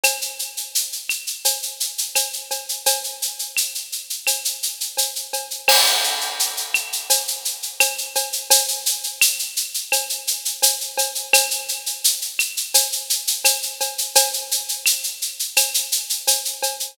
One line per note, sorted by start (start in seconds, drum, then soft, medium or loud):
0.03 cowbell medium
0.03 claves loud
0.03 shaker loud
0.21 shaker medium
0.39 shaker medium
0.57 shaker medium
0.75 shaker loud
0.92 shaker medium
1.09 claves medium
1.09 shaker medium
1.27 shaker medium
1.45 cowbell medium
1.45 shaker loud
1.62 shaker medium
1.80 shaker medium
1.98 shaker medium
2.15 cowbell medium
2.15 claves medium
2.15 shaker loud
2.33 shaker medium
2.51 cowbell medium
2.51 shaker medium
2.69 shaker medium
2.86 cowbell loud
2.86 shaker loud
3.04 shaker medium
3.22 shaker medium
3.39 shaker medium
3.56 claves medium
3.56 shaker loud
3.75 shaker medium
3.92 shaker medium
4.10 shaker medium
4.27 cowbell medium
4.27 claves medium
4.27 shaker loud
4.45 shaker medium
4.62 shaker medium
4.80 shaker medium
4.97 cowbell medium
4.97 shaker loud
5.16 shaker medium
5.33 cowbell medium
5.33 shaker medium
5.51 shaker medium
5.68 crash loud
5.68 cowbell loud
5.68 claves loud
5.86 shaker medium
6.04 shaker medium
6.21 shaker medium
6.39 shaker loud
6.57 shaker medium
6.74 claves loud
6.74 shaker medium
6.92 shaker medium
7.10 cowbell medium
7.10 shaker loud
7.28 shaker medium
7.45 shaker medium
7.62 shaker medium
7.80 cowbell medium
7.80 claves loud
7.80 shaker loud
7.98 shaker medium
8.15 cowbell medium
8.15 shaker medium
8.32 shaker medium
8.50 cowbell loud
8.50 shaker loud
8.68 shaker medium
8.86 shaker loud
9.03 shaker medium
9.21 claves loud
9.21 shaker loud
9.39 shaker medium
9.56 shaker medium
9.74 shaker medium
9.92 cowbell medium
9.92 claves medium
9.92 shaker loud
10.09 shaker medium
10.27 shaker medium
10.45 shaker medium
10.62 cowbell medium
10.62 shaker loud
10.81 shaker medium
10.97 cowbell medium
10.97 shaker medium
11.15 shaker medium
11.33 cowbell loud
11.33 claves loud
11.33 shaker loud
11.51 shaker medium
11.68 shaker medium
11.86 shaker medium
12.04 shaker loud
12.21 shaker medium
12.39 claves loud
12.39 shaker medium
12.57 shaker medium
12.74 cowbell medium
12.74 shaker loud
12.92 shaker medium
13.10 shaker loud
13.27 shaker loud
13.44 cowbell medium
13.44 claves medium
13.44 shaker loud
13.62 shaker medium
13.80 cowbell medium
13.80 shaker medium
13.98 shaker medium
14.15 cowbell loud
14.15 shaker loud
14.33 shaker medium
14.51 shaker medium
14.69 shaker medium
14.86 claves loud
14.86 shaker loud
15.03 shaker medium
15.22 shaker medium
15.39 shaker medium
15.56 cowbell medium
15.56 claves loud
15.56 shaker loud
15.74 shaker loud
15.92 shaker loud
16.10 shaker medium
16.27 cowbell medium
16.27 shaker loud
16.45 shaker medium
16.62 cowbell medium
16.62 shaker medium
16.80 shaker medium